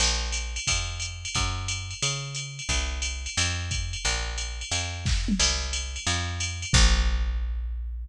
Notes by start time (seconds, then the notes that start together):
0.00 A#1, crash, ride
0.32 hi-hat pedal, ride
0.56 ride
0.67 F2, kick, ride
1.00 hi-hat pedal, ride
1.25 ride
1.35 F#2, kick, ride
1.68 hi-hat pedal, ride
1.91 ride
2.02 C#3, ride
2.35 hi-hat pedal, ride
2.59 ride
2.69 C2, kick, ride
3.02 hi-hat pedal, ride
3.26 ride
3.37 F2, ride
3.71 kick, hi-hat pedal, ride
3.93 ride
4.05 A#1, ride
4.38 hi-hat pedal, ride
4.61 ride
4.71 F2, ride
5.06 kick, snare
5.28 mid tom
5.39 C2, crash, ride
5.73 hi-hat pedal, ride
5.96 ride
6.07 F2, ride
6.40 hi-hat pedal, ride
6.62 ride
6.73 A#1, kick, crash